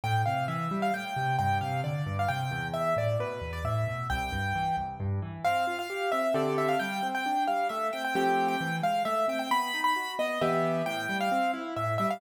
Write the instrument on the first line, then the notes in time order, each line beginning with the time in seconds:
acoustic grand piano
0.04 A2 G5
0.26 C3 F5
0.48 E3 E5
0.71 G3
0.82 F5
0.94 A2 G5
1.16 C3
1.39 G2 G5
1.61 C3 F5
1.84 D3 D5
2.06 G2
2.19 F5
2.28 C3 G5
2.51 E2
2.73 E5
2.96 A2 D5
3.19 B2 B4
3.41 E2
3.53 D5
3.64 A2 E5
3.87 B2
4.10 C2 G5
4.32 G2
4.55 E3
4.77 C2
5.00 G2
5.22 E3
5.44 C4 F5
5.67 F4
5.79 F5
5.90 G4
6.12 C4 E5
6.34 D3 C4 G4 A4 D5
6.58 E5
6.68 F5
6.79 G3 G5
7.03 C4
7.15 G5
7.26 D4
7.47 G3 F5
7.69 A3 E5
7.93 C4 G5
8.05 G5
8.15 F3 A3 C4 G4 G5
8.48 G5
8.61 E3
8.83 G#3 F5
9.05 A3 E5
9.28 C4 G5
9.39 G5
9.51 B3 B5
9.74 D#4
9.84 B5
9.96 F#4
10.19 B3 D#5
10.41 E3 B3 G4 E5
10.86 A2 G5
11.09 G3
11.20 F5
11.32 C4
11.54 E4
11.76 A2 E5
11.98 G3 E5
12.10 F5